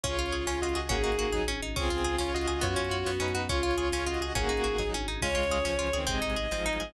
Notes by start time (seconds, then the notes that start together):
0.03 C#2 C#4 F4 G#4 C#5, kick, closed hi-hat
0.18 C#2 F4
0.26 closed hi-hat
0.32 C#2 G#4
0.47 C#2 C#4 F4 C#5, snare
0.62 C#2 F4 F#4 D#5
0.69 closed hi-hat
0.75 C#2 F#4 G#4 D#5
0.89 G#1 A#3 C#4 D#4 F#4 G#4, kick, closed hi-hat
1.04 G#1 D#4
1.12 closed hi-hat
1.19 G#1 F#4
1.32 G#1 F#3 D#4 G#4, kick, snare
1.48 G#1 C#4, high tom
1.62 G#1 D#4
1.76 C#2 C4 C#4 F4 G#4, kick, crash
1.90 C#2 F4
1.98 closed hi-hat
2.04 C#2 G#4
2.18 C#2 C#4 F4 C#5, snare
2.34 C#2 F4 F#4 D#5
2.41 closed hi-hat
2.47 C#2 F#4 G#4 D#5
2.61 F#2 B3 C#4 F4 F#4 C#5, kick, closed hi-hat
2.76 F#2 C#4
2.84 closed hi-hat
2.91 F#2 F#4
3.06 F#2 B3, snare
3.20 F#2 C#4 D#4 B4
3.28 closed hi-hat
3.35 F#2 F#4
3.49 C#2 C#4 F4 G#4 C#5, kick, closed hi-hat
3.63 C#2 F4
3.71 closed hi-hat
3.78 C#2 G#4
3.92 C#2 C#4 F4 C#5, snare
4.06 C#2 F4 F#4 D#5
4.14 closed hi-hat
4.21 C#2 F#4 G#4 D#5
4.35 G#1 A#3 C#4 D#4 F#4 G#4, kick, closed hi-hat
4.49 G#1 D#4
4.57 closed hi-hat
4.64 G#1 F#4
4.78 G#1 F#3 D#4 G#4, kick, snare
4.93 G#1 C#4, high tom
5.07 G#1 D#4
5.21 C#2 G#3 C#4 F4 G#4 C#5, kick, crash
5.35 C#2 F4
5.43 closed hi-hat
5.50 C#2 G#4
5.65 C#2 F3 C#4, snare
5.79 C#2 F4
5.87 closed hi-hat
5.93 C#2 D#3 C4 G#4
6.07 G#1 C3 G#3 C4 D#4 G#4 D#5, kick, closed hi-hat
6.22 G#1 D#4
6.30 closed hi-hat
6.36 G#1 G#4
6.51 G#1 G#2 F3 C4, snare
6.66 G#1 D#4
6.73 closed hi-hat
6.80 G#1 G#2 F3 G#4